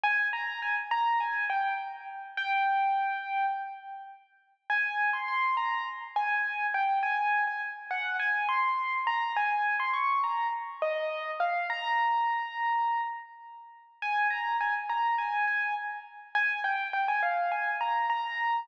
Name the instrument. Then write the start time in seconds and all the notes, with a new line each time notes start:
acoustic grand piano
0.04 G#5
0.33 A#5
0.62 G#5
0.91 A#5
1.20 G#5
1.50 G5
2.37 G5
4.70 G#5
5.13 C6
5.28 C6
5.57 A#5
6.16 G#5
6.74 G5
7.03 G#5
7.47 G#5
7.91 F#5
8.20 G#5
8.49 C6
9.07 A#5
9.37 G#5
9.80 C6
9.93 C#6
10.24 A#5
10.82 D#5
11.40 F5
11.70 A#5
14.02 G#5
14.30 A#5
14.61 G#5
14.89 A#5
15.18 G#5
15.47 G#5
16.35 G#5
16.64 G5
16.93 G5
17.08 G#5
17.23 F5
17.52 G#5
17.81 A#5
18.10 A#5